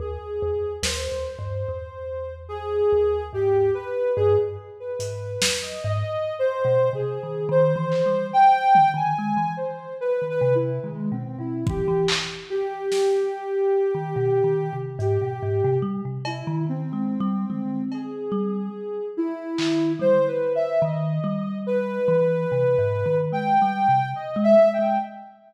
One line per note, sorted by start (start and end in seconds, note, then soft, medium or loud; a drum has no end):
0.00 0.18 D#2 loud
0.00 0.73 G#4 medium
0.42 0.61 E2 loud
0.83 1.08 D#2 loud
0.83 2.34 C5 medium
0.83 snare loud
1.12 1.37 D#2 medium
1.39 1.64 G2 medium
1.69 2.81 E2 medium
2.49 3.24 G#4 loud
2.92 3.30 D#2 medium
3.33 3.70 G#2 medium
3.33 3.71 G4 loud
3.74 4.12 B4 medium
4.16 4.36 G2 loud
4.16 4.35 G#4 loud
4.39 4.57 G2 medium
4.80 5.55 B4 medium
4.99 5.37 G#2 medium
4.99 closed hi-hat loud
5.42 5.61 E2 medium
5.42 snare loud
5.62 5.81 D#5 medium
5.84 6.03 G#2 loud
5.84 6.34 D#5 medium
6.39 6.89 C5 loud
6.65 6.90 B2 medium
6.93 7.18 C3 medium
6.93 7.45 G#4 medium
7.23 7.48 D#3 medium
7.49 7.74 D#3 loud
7.49 8.26 C5 loud
7.76 8.01 E3 loud
7.92 clap medium
8.06 8.31 G3 medium
8.33 8.89 G5 loud
8.75 floor tom medium
8.94 9.13 D#3 medium
8.94 9.52 G#5 medium
9.19 9.37 G#3 medium
9.37 9.56 E3 medium
9.57 9.94 C5 medium
10.01 10.26 B4 medium
10.22 10.40 D#3 medium
10.30 10.55 B4 loud
10.41 10.79 C3 loud
10.55 10.80 E4 medium
10.83 11.09 D#3 medium
10.83 11.08 G#3 medium
11.12 11.37 B2 medium
11.12 11.37 C4 medium
11.39 11.64 B2 medium
11.39 11.64 E4 medium
11.66 11.85 E3 medium
11.66 12.06 G4 loud
11.66 kick loud
11.88 12.07 E3 loud
12.08 clap loud
12.50 14.75 G4 loud
12.92 snare medium
13.95 14.13 D#3 medium
14.16 14.41 B2 loud
14.44 14.69 D#3 medium
14.73 14.98 C3 medium
14.99 15.18 G#2 loud
14.99 15.76 G4 loud
14.99 closed hi-hat medium
15.22 15.40 B2 medium
15.43 15.61 G#2 loud
15.64 15.83 C3 loud
15.82 16.01 G3 medium
16.05 16.43 C3 medium
16.25 16.63 E4 medium
16.25 cowbell loud
16.47 16.66 D#3 loud
16.67 16.92 D#3 medium
16.67 17.81 C4 medium
16.93 17.18 G#3 medium
17.20 17.45 G3 loud
17.50 17.87 G#3 medium
17.50 floor tom medium
17.92 19.06 G#4 medium
17.92 cowbell medium
18.32 18.69 G3 loud
19.17 19.92 E4 loud
19.58 19.96 D#3 medium
19.58 clap medium
19.99 20.18 G3 medium
19.99 20.26 C5 loud
19.99 floor tom medium
20.27 20.52 B4 medium
20.55 20.80 E5 medium
20.82 21.19 D#3 loud
20.82 21.58 D#5 medium
21.24 21.99 G3 loud
21.67 23.17 B4 loud
22.08 22.46 E3 loud
22.52 22.77 C3 medium
22.78 23.03 G#2 medium
23.06 23.31 D#3 medium
23.32 23.57 G#3 medium
23.32 24.07 G5 medium
23.62 23.87 G3 medium
23.89 24.14 C3 medium
24.15 24.40 D#5 medium
24.36 24.55 G#3 loud
24.44 24.69 E5 loud
24.59 24.78 G#3 medium
24.73 24.98 G5 medium
24.79 24.98 G#3 medium